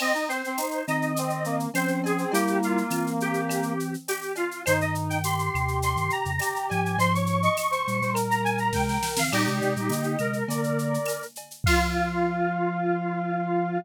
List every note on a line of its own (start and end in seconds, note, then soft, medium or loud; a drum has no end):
0.00 0.13 C4 loud
0.00 0.29 D#5 medium
0.00 crash medium
0.00 cowbell medium
0.00 claves loud
0.14 0.28 D#4 medium
0.14 shaker medium
0.28 0.42 C4 medium
0.28 0.85 C5 medium
0.28 shaker medium
0.44 0.60 C4 loud
0.44 shaker medium
0.57 0.83 D#4 medium
0.57 tambourine medium
0.57 shaker medium
0.71 shaker medium
0.87 1.67 D#3 medium
0.87 1.67 C4 loud
0.87 1.12 D#4 medium
0.87 1.58 D#5 medium
0.87 claves medium
0.87 shaker medium
1.02 shaker medium
1.16 1.46 C4 loud
1.16 cowbell medium
1.16 shaker loud
1.30 shaker medium
1.44 1.69 A#3 loud
1.44 shaker medium
1.60 shaker medium
1.74 2.25 F3 medium
1.74 2.17 C4 medium
1.74 2.25 C#4 loud
1.74 2.00 C5 medium
1.74 tambourine medium
1.74 cowbell medium
1.74 claves medium
1.74 shaker medium
1.88 shaker medium
2.04 2.32 G#4 medium
2.04 cowbell medium
2.04 shaker medium
2.18 2.32 C4 loud
2.18 shaker medium
2.32 2.83 G3 loud
2.32 3.73 A#3 loud
2.32 2.83 E4 loud
2.32 2.59 G4 medium
2.32 cowbell medium
2.32 shaker loud
2.47 shaker medium
2.62 3.10 F4 medium
2.62 shaker medium
2.78 shaker medium
2.90 3.96 E3 medium
2.90 3.96 C4 medium
2.90 tambourine medium
2.90 claves medium
2.90 shaker medium
3.07 shaker medium
3.20 3.94 G4 medium
3.20 shaker medium
3.34 shaker medium
3.49 cowbell medium
3.49 claves medium
3.49 shaker loud
3.63 shaker medium
3.80 shaker medium
3.94 shaker medium
4.08 4.34 G4 medium
4.08 tambourine medium
4.08 cowbell medium
4.08 shaker medium
4.22 shaker medium
4.35 4.62 F4 medium
4.35 cowbell medium
4.35 shaker medium
4.51 shaker medium
4.66 5.49 G2 medium
4.66 5.49 D#3 loud
4.66 5.18 D#4 loud
4.66 4.79 C5 medium
4.66 cowbell medium
4.66 claves loud
4.66 shaker loud
4.80 4.94 D#5 medium
4.80 shaker medium
4.95 shaker medium
5.09 5.23 G5 medium
5.09 shaker medium
5.23 6.30 G4 medium
5.23 5.78 C6 medium
5.23 tambourine medium
5.23 shaker loud
5.39 shaker medium
5.54 5.95 D#2 medium
5.54 5.95 C3 loud
5.54 claves medium
5.54 shaker medium
5.68 shaker medium
5.82 6.11 C6 medium
5.82 cowbell medium
5.82 shaker medium
5.96 6.09 G2 medium
5.96 6.09 D#3 medium
5.96 shaker medium
6.10 6.68 A#5 medium
6.10 shaker medium
6.25 6.39 F2 medium
6.25 6.39 C#3 medium
6.25 shaker medium
6.39 6.96 G4 loud
6.39 tambourine medium
6.39 cowbell medium
6.39 claves medium
6.39 shaker loud
6.56 shaker medium
6.69 6.97 G#2 medium
6.69 6.97 F3 loud
6.69 6.97 G#5 medium
6.69 cowbell medium
6.69 shaker medium
6.86 shaker medium
6.98 7.48 G#2 loud
6.98 7.48 F3 loud
6.98 7.13 C5 loud
6.98 7.13 C6 medium
6.98 cowbell medium
6.98 shaker medium
7.13 7.39 C#5 medium
7.13 7.27 C#6 medium
7.13 shaker medium
7.26 7.42 C#6 medium
7.26 shaker medium
7.42 7.56 D#5 loud
7.42 7.57 C#6 medium
7.42 shaker medium
7.57 7.70 D#5 medium
7.57 7.71 C#6 medium
7.57 tambourine medium
7.57 claves medium
7.57 shaker loud
7.71 7.99 C5 medium
7.71 8.13 C#6 medium
7.71 shaker medium
7.87 8.01 A#2 medium
7.87 8.01 G3 medium
7.87 shaker medium
8.01 8.71 A#2 medium
8.01 8.71 G3 medium
8.01 8.16 C5 loud
8.01 shaker medium
8.13 9.19 A#4 loud
8.13 cowbell medium
8.13 claves medium
8.13 shaker loud
8.29 8.43 A#5 medium
8.29 shaker medium
8.44 8.58 G#5 medium
8.44 shaker medium
8.58 8.73 A#5 medium
8.58 shaker medium
8.73 8.98 C3 medium
8.73 8.98 G#3 loud
8.73 8.87 G5 medium
8.73 kick medium
8.73 snare medium
8.88 9.12 G5 medium
8.88 snare medium
9.03 snare medium
9.16 9.30 D#3 medium
9.16 9.30 C4 medium
9.16 9.32 F5 medium
9.16 snare loud
9.32 9.46 A#2 medium
9.32 9.46 G3 loud
9.32 10.17 D#4 medium
9.32 10.17 G4 medium
9.32 9.59 D5 loud
9.32 crash loud
9.32 cowbell medium
9.32 claves loud
9.47 9.61 C3 medium
9.47 9.61 G#3 loud
9.47 shaker medium
9.60 9.75 C3 medium
9.60 9.75 G#3 medium
9.60 9.74 D5 medium
9.60 shaker medium
9.76 9.90 A#2 medium
9.76 9.90 G3 medium
9.76 shaker medium
9.89 10.16 D3 medium
9.89 10.16 A#3 loud
9.89 10.37 D#5 loud
9.89 tambourine medium
9.89 shaker medium
10.03 shaker medium
10.18 10.44 C3 medium
10.18 10.44 G#3 medium
10.18 11.24 A#4 medium
10.18 claves medium
10.18 shaker medium
10.33 shaker medium
10.48 10.98 D3 medium
10.48 10.98 A#3 loud
10.48 11.22 D5 medium
10.48 cowbell medium
10.48 shaker loud
10.64 shaker medium
10.79 shaker medium
10.94 shaker medium
11.06 tambourine medium
11.06 cowbell medium
11.06 claves medium
11.06 shaker medium
11.22 shaker medium
11.36 cowbell medium
11.36 shaker medium
11.51 shaker medium
11.64 13.78 F3 loud
11.64 13.78 F4 loud
11.64 13.79 F5 loud
11.64 kick loud
11.64 crash loud